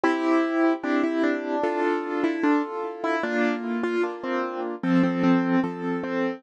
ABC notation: X:1
M:4/4
L:1/16
Q:1/4=75
K:F
V:1 name="Acoustic Grand Piano"
E4 D E D3 z2 E D z2 E | D2 z F z C2 z C C C2 z2 C2 |]
V:2 name="Acoustic Grand Piano"
[CG]4 [CEG]4 [DFA]4 [FA]4 | [B,F]4 [B,DF]4 [F,A]4 [F,CA]4 |]